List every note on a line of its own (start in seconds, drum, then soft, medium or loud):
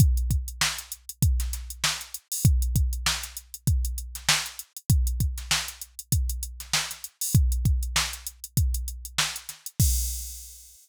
0.00 kick loud
0.00 closed hi-hat loud
0.17 closed hi-hat medium
0.30 kick medium
0.30 closed hi-hat medium
0.48 closed hi-hat medium
0.61 snare loud
0.78 closed hi-hat medium
0.92 closed hi-hat medium
1.09 closed hi-hat medium
1.22 kick loud
1.22 closed hi-hat loud
1.40 snare medium
1.40 closed hi-hat medium
1.53 snare soft
1.53 closed hi-hat loud
1.70 closed hi-hat medium
1.84 snare loud
2.01 closed hi-hat medium
2.14 closed hi-hat loud
2.32 open hi-hat medium
2.45 kick loud
2.45 closed hi-hat loud
2.62 closed hi-hat medium
2.76 kick loud
2.76 closed hi-hat loud
2.93 closed hi-hat medium
3.06 snare loud
3.23 snare soft
3.23 closed hi-hat medium
3.37 closed hi-hat medium
3.54 closed hi-hat medium
3.67 kick loud
3.67 closed hi-hat loud
3.85 closed hi-hat medium
3.98 closed hi-hat medium
4.15 snare soft
4.15 closed hi-hat medium
4.29 snare loud
4.46 closed hi-hat medium
4.59 closed hi-hat medium
4.77 closed hi-hat medium
4.90 kick loud
4.90 closed hi-hat loud
5.07 closed hi-hat medium
5.20 kick medium
5.20 closed hi-hat medium
5.38 snare soft
5.38 closed hi-hat medium
5.51 snare loud
5.68 closed hi-hat medium
5.82 closed hi-hat medium
5.99 closed hi-hat medium
6.12 kick loud
6.12 closed hi-hat loud
6.29 closed hi-hat loud
6.43 closed hi-hat loud
6.60 snare soft
6.60 closed hi-hat medium
6.73 snare loud
6.91 snare soft
6.91 closed hi-hat medium
7.04 closed hi-hat medium
7.21 open hi-hat loud
7.35 kick loud
7.35 closed hi-hat loud
7.52 closed hi-hat medium
7.65 kick loud
7.65 closed hi-hat medium
7.83 closed hi-hat medium
7.96 snare loud
8.13 closed hi-hat medium
8.27 closed hi-hat loud
8.44 closed hi-hat medium
8.57 kick loud
8.57 closed hi-hat loud
8.74 closed hi-hat loud
8.88 closed hi-hat medium
9.05 closed hi-hat medium
9.18 snare loud
9.36 closed hi-hat medium
9.49 snare soft
9.49 closed hi-hat medium
9.66 closed hi-hat medium
9.80 kick loud
9.80 crash loud